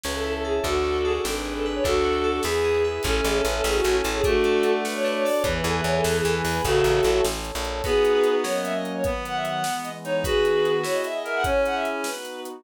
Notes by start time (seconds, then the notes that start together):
0.04 C#2 C#4 B4 C#5 E5 A5, snare
0.15 A4
0.24 E4 A4
0.33 A4, ride
0.44 G#4 A4
0.64 D2 D4 F#4 A4, kick, ride
0.84 F#4
0.94 ride
1.04 G#4 A4
1.24 G#1 D4 G#4 A4 B4, snare
1.34 B4
1.44 G#4 B4
1.56 A4, ride
1.65 B4
1.74 C#5
1.83 D2 D4 F#4 A4, kick, ride
2.04 F#4
2.13 ride
2.24 A4
2.43 E2 E4 G#4 B4, snare
2.64 G#4
2.75 ride
2.84 B4
3.03 A1 C#4 A4 C#5 E5 A5, kick, crash
3.16 A4
3.24 A1 G#4 A4, closed hi-hat
3.36 A4
3.45 A1 C#4 B4, closed hi-hat
3.55 A4
3.64 A1 E4 G#4 A4 C#5 A5, snare
3.75 F#4
3.84 A1 C#4 F#4, closed hi-hat
4.04 A1 A4, closed hi-hat
4.15 G#4
4.24 A3 D4 F#4 A4 D5 F#5 A5, kick, closed hi-hat
4.44 A4, closed hi-hat
4.63 D4, closed hi-hat
4.83 F#4 B4 D5 A5 D6, snare
4.94 C#5
5.04 D4 B4, snare
5.14 C#5
5.25 A4 D5, open hi-hat
5.36 C#5
5.44 E2 E3 B3 B4 E5 G#5, kick, closed hi-hat
5.54 B4
5.64 E2 G#4 A4, closed hi-hat
5.74 B4
5.84 E2 B3 C#5
5.96 A4
6.04 E2 E4 A4 B4 G#5 B5, snare
6.15 G#4
6.24 E2 B3 A4, closed hi-hat
6.45 E2 G#4, open hi-hat
6.53 B4
6.64 A1 C#3 F#4 A4 C#5 E5 A5, kick, closed hi-hat
6.84 A1, closed hi-hat
7.03 A1, closed hi-hat
7.24 A1 A4 C#5 A5, snare
7.45 closed hi-hat
7.55 A#1
7.65 closed hi-hat
7.84 B3 D#4 F#4 G#4 B4, kick, crash
8.05 closed hi-hat
8.24 closed hi-hat
8.44 F#3 A#3 C#4 A#4 C#5, snare
8.54 D#5
8.63 E5, closed hi-hat
8.74 D#5
8.83 D#5, closed hi-hat
8.95 C#5
9.04 D#3 F#3 B3 B4, kick, closed hi-hat
9.25 F#5, closed hi-hat
9.35 E5
9.45 F#5, closed hi-hat
9.63 E3 G#3 B3, snare
9.83 D#5, closed hi-hat
10.04 D#4 C#5, closed hi-hat
10.24 D#3 B3 D#4 F#4 G#4 B4, kick, closed hi-hat
10.45 closed hi-hat
10.65 closed hi-hat
10.83 B3 E4 G#4 C#5, snare
10.93 D#5
11.04 E5, closed hi-hat
11.14 D#5
11.24 A#4 E5, closed hi-hat
11.35 F#5
11.44 C#4 E4 G#4 C#5, kick, closed hi-hat
11.65 F#5, closed hi-hat
11.74 E5
11.85 closed hi-hat
12.04 B3 D#4 F#4 B4, snare
12.25 closed hi-hat
12.45 closed hi-hat